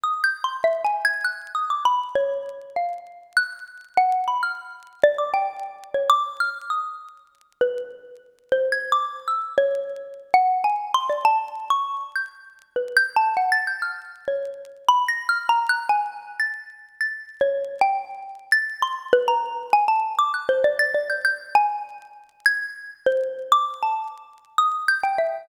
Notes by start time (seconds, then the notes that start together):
0.04 D#6
0.24 G6
0.44 C6
0.64 E5
0.85 G#5
1.05 G#6
1.24 F#6
1.55 D#6
1.70 D6
1.85 B5
2.15 C#5
2.76 F5
3.37 F#6
3.97 F#5
4.28 B5
4.43 F6
5.04 D5
5.18 D6
5.34 G5
5.94 C#5
6.10 D6
6.40 F6
6.70 D#6
7.61 B4
8.52 C5
8.72 G#6
8.92 D6
9.28 E6
9.58 C#5
10.34 F#5
10.64 G#5
10.94 C6
11.10 D5
11.25 A5
11.70 C#6
12.16 G6
12.76 B4
12.97 G6
13.16 A5
13.37 F#5
13.52 A6
13.67 G6
13.82 F6
14.28 C#5
14.89 B5
15.08 A#6
15.29 F6
15.49 A#5
15.69 F#6
15.89 G#5
16.40 A6
17.01 A6
17.41 C#5
17.81 G5
18.52 A6
18.82 C6
19.13 B4
19.28 A#5
19.73 G#5
19.88 A5
20.19 D6
20.34 F#6
20.49 C5
20.64 D5
20.79 A6
20.94 D5
21.10 G6
21.25 G6
21.55 G#5
22.46 G#6
23.06 C5
23.52 D6
23.83 A5
24.58 D#6
24.88 G6
25.04 G5
25.18 E5